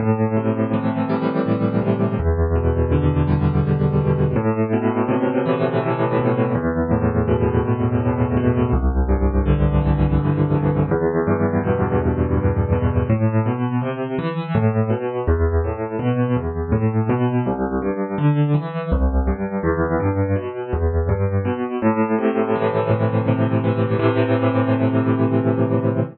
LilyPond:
\new Staff { \clef bass \time 6/8 \key a \minor \tempo 4. = 55 a,8 c8 e8 g8 a,8 c8 | e,8 b,8 d8 g8 e,8 b,8 | a,8 b,8 c8 e8 a,8 b,8 | e,8 a,8 b,8 e,8 a,8 b,8 |
c,8 g,8 d8 e8 c,8 g,8 | e,8 g,8 b,8 e,8 g,8 b,8 | a,8 b,8 c8 e8 a,8 b,8 | e,8 a,8 b,8 e,8 a,8 b,8 |
c,8 g,8 d8 e8 c,8 g,8 | e,8 g,8 b,8 e,8 g,8 b,8 | a,8 c8 e8 a,8 c8 e8 | <a, c e>2. | }